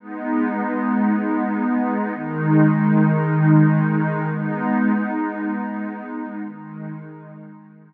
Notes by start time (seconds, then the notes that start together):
0.00 G#3 B3 D#4
2.14 D#3 G#3 D#4
4.29 G#3 B3 D#4
6.43 D#3 G#3 D#4